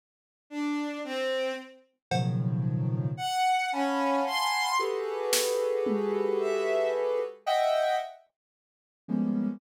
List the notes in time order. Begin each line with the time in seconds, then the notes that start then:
0.50 D4
1.04 C4
2.11 A2 B2 C#3 D#3 F3 F#3, cowbell
3.17 F#5
3.72 C#4 F5 F#5 G#5 A5 B5
4.27 C6
4.79 F#4 G4 G#4 A4 B4
5.33 snare
5.86 high tom
6.40 E5
7.46 D#5 E5 F#5 G5
9.08 F3 G3 G#3 A#3 B3 C#4